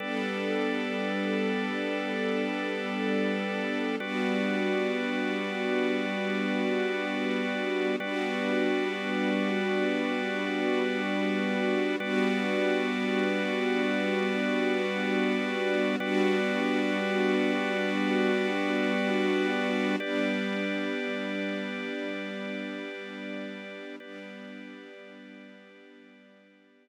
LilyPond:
<<
  \new Staff \with { instrumentName = "String Ensemble 1" } { \time 6/8 \key g \lydian \tempo 4. = 60 <g b d' a'>2.~ | <g b d' a'>2. | <g b d' fis'>2.~ | <g b d' fis'>2. |
<g b d' fis'>2.~ | <g b d' fis'>2. | <g b d' fis'>2.~ | <g b d' fis'>2. |
<g b d' fis'>2.~ | <g b d' fis'>2. | <g b d'>2.~ | <g b d'>2. |
<g b d'>2.~ | <g b d'>2. | }
  \new Staff \with { instrumentName = "Drawbar Organ" } { \time 6/8 \key g \lydian <g a' b' d''>2.~ | <g a' b' d''>2. | <g fis' b' d''>2.~ | <g fis' b' d''>2. |
<g fis' b' d''>2.~ | <g fis' b' d''>2. | <g fis' b' d''>2.~ | <g fis' b' d''>2. |
<g fis' b' d''>2.~ | <g fis' b' d''>2. | <g' b' d''>2.~ | <g' b' d''>2. |
<g' b' d''>2.~ | <g' b' d''>2. | }
>>